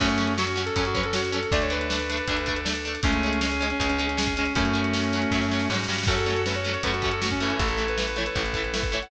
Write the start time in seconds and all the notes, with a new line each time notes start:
0.00 F#2 F#3 A3 C#4 F#4, kick, crash
0.09 closed hi-hat
0.18 F#3 C#4, closed hi-hat
0.27 closed hi-hat
0.38 F#3 C#4 F#4, snare
0.47 closed hi-hat
0.56 F#3 C#4, snare, closed hi-hat
0.66 A4, closed hi-hat
0.76 F#2 F#3 C#4, kick, closed hi-hat
0.85 F#4, closed hi-hat
0.94 F#3 C#4 B4, kick, closed hi-hat
1.03 A4, closed hi-hat
1.13 F#3 C#4 F#4, snare
1.25 closed hi-hat
1.32 F#3 C#4 A4, closed hi-hat
1.43 closed hi-hat
1.52 D2 A3 D4 A4 D5, kick, closed hi-hat
1.62 C#5, closed hi-hat
1.70 A3 D4 B4, closed hi-hat
1.81 closed hi-hat
1.90 A3 D4, snare
1.99 closed hi-hat
2.09 A3 D4, snare, closed hi-hat
2.17 closed hi-hat
2.27 D2 A3 D4, kick, closed hi-hat
2.37 closed hi-hat
2.46 A3 D4, kick, closed hi-hat
2.56 closed hi-hat
2.65 A3 D4, snare
2.75 closed hi-hat
2.85 A3 D4, closed hi-hat
2.95 closed hi-hat
3.03 C#2 G#3 A3 C#4 G#4, kick, closed hi-hat
3.12 closed hi-hat
3.23 G#3 C#4, closed hi-hat
3.33 closed hi-hat
3.41 G#3 C#4, snare
3.51 closed hi-hat
3.61 G#3 C#4, snare, closed hi-hat
3.70 C#4, closed hi-hat
3.80 C#2 G#3 C#4, kick, closed hi-hat
3.89 C#4, closed hi-hat
3.98 G#3 C#4, closed hi-hat
4.08 C#4, closed hi-hat
4.17 G#3 C#4, snare
4.27 kick, closed hi-hat
4.37 G#3 C#4, closed hi-hat
4.45 closed hi-hat
4.55 F#2 F#3 A3 C#4 F#4, kick, closed hi-hat
4.65 closed hi-hat
4.73 F#3 C#4, closed hi-hat
4.84 closed hi-hat
4.94 F#3 C#4, snare
5.04 closed hi-hat
5.13 F#3 C#4, snare, closed hi-hat
5.22 closed hi-hat
5.31 F#2 F#3 C#4, kick, snare
5.42 snare
5.51 F#3 C#4, snare
5.59 snare
5.70 G#2 F#3 C#4, snare
5.74 snare
5.79 snare
5.83 snare
5.88 G2 F#3 C#4, snare
5.93 snare
5.98 snare
6.03 C#4 F#4 A4, kick, snare, crash
6.07 F#2 F#3 A3 C#4 F#4 A4
6.18 closed hi-hat
6.26 F#3 A3 C#4, closed hi-hat
6.36 closed hi-hat
6.46 F#3 A3 C#4 B4, snare
6.54 C#5, closed hi-hat
6.64 F#3 A3 C#4, snare, closed hi-hat
6.73 C#5, closed hi-hat
6.83 F#2 A3 C#4 B4, kick, closed hi-hat
6.87 F#3
6.93 F#4, closed hi-hat
7.02 F#3 A3 C#4 F#4, kick, closed hi-hat
7.11 A4, closed hi-hat
7.22 F#3 A3 C#4 F#4, snare
7.30 C#4, kick, closed hi-hat
7.40 E3 A3 C#4, closed hi-hat
7.49 C#4, closed hi-hat
7.59 A1 E4 A4, kick, closed hi-hat
7.68 A4, closed hi-hat
7.77 E3 A3, closed hi-hat
7.88 B4, closed hi-hat
7.97 E3 A3 B4, snare
8.08 B4, closed hi-hat
8.16 E3 A3 C#5, snare, closed hi-hat
8.26 B4, closed hi-hat
8.35 A1 E3 A3, kick, closed hi-hat
8.46 closed hi-hat
8.54 E3 A3, kick, closed hi-hat
8.64 closed hi-hat
8.74 E3 A3, snare
8.83 kick, closed hi-hat
8.92 E3 A3 C#5, closed hi-hat
9.02 F#5, closed hi-hat